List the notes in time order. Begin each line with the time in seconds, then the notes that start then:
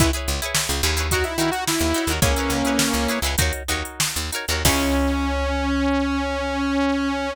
0.00 C#2 E4 G#4 B4 C#5, kick, closed hi-hat
0.13 E4 G#4 B4 C#5, closed hi-hat
0.28 C#2, closed hi-hat
0.42 E4 G#4 B4 C#5, closed hi-hat
0.55 snare
0.69 C#2, closed hi-hat
0.83 D#2 E4 G#4 B4 C#5, closed hi-hat
0.97 E4 G#4 B4 C#5, closed hi-hat
1.11 D#4 F#4 A#4 C#5, kick, closed hi-hat
1.24 E4, snare, closed hi-hat
1.38 D#3 D#4 E4 F#4 A#4, closed hi-hat
1.42 C#5
1.51 F#4, closed hi-hat
1.67 E4, snare
1.80 D#2, snare, closed hi-hat
1.94 D#4 F#4 A#4 C#5, closed hi-hat
2.07 D#2 D#4 F#4, closed hi-hat
2.11 A#4 C#5
2.22 C#2 A#3 C#4 E4 G#4 B4 C#5, kick, closed hi-hat
2.36 E4 G#4 B4 C#5, closed hi-hat
2.50 C#2, closed hi-hat
2.65 E4 G#4 B4 C#5, closed hi-hat
2.79 snare
2.94 C#2, closed hi-hat
3.08 E4 G#4 B4 C#5, closed hi-hat
3.22 C#2 E4 G#4 B4, closed hi-hat
3.27 C#5
3.38 D#2 D#4 F#4 A#4, kick, closed hi-hat
3.42 C#5
3.53 closed hi-hat
3.68 D#2 D#4 F#4 A#4 C#5, closed hi-hat
3.85 closed hi-hat
4.00 snare
4.16 D#2, closed hi-hat
4.32 D#4 F#4 A#4 C#5, closed hi-hat
4.48 D#2 D#4 F#4 A#4, closed hi-hat
4.52 C#5
4.65 C#2 C#4 E4 G#4 B4, kick, crash
4.69 C#5